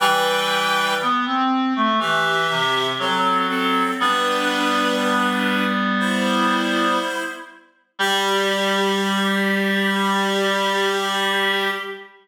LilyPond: <<
  \new Staff \with { instrumentName = "Clarinet" } { \time 4/4 \key g \major \tempo 4 = 60 <b' g''>4 r4 <g' e''>4 <c' a'>8 <c' a'>8 | <d' b'>2 <e' c''>4. r8 | g'1 | }
  \new Staff \with { instrumentName = "Clarinet" } { \time 4/4 \key g \major <e g>4 b16 c'8 a16 e8 c8 fis4 | <g b>2.~ <g b>8 r8 | g1 | }
>>